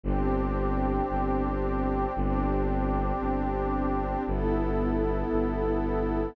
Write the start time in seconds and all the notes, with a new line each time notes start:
0.04 G1 C4 D4 G4
1.09 G1
2.15 G1 C4 D4 G4
3.19 G1
4.26 G1 B3 E4 A4
5.30 G1